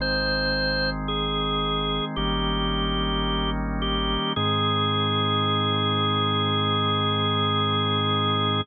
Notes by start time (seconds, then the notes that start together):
0.00 G#1 D#3 G#3 C4 C5
1.08 G#4
2.16 G#1 D#3 G3 A#3 C#4 G4
3.82 G4
4.36 G#2 D#3 G#3 C4 G#4